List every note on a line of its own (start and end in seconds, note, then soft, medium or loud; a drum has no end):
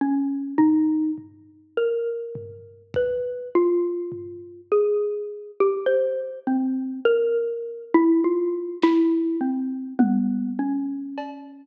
0.01 0.54 C#4 medium
0.58 1.11 D#4 medium
0.58 floor tom medium
1.18 floor tom medium
1.77 2.83 A#4 medium
2.35 floor tom medium
2.94 3.49 B4 medium
2.94 kick loud
3.55 4.61 F4 medium
4.12 floor tom medium
4.72 5.51 G#4 medium
5.60 5.87 G4 medium
5.86 6.39 C5 medium
6.47 7.00 C4 medium
7.05 7.85 A#4 medium
7.94 8.21 E4 loud
8.24 8.77 F4 medium
8.82 9.36 E4 loud
8.82 snare medium
9.41 9.94 C4 medium
9.99 10.52 B3 medium
9.99 high tom medium
10.59 11.65 C#4 medium
11.18 cowbell medium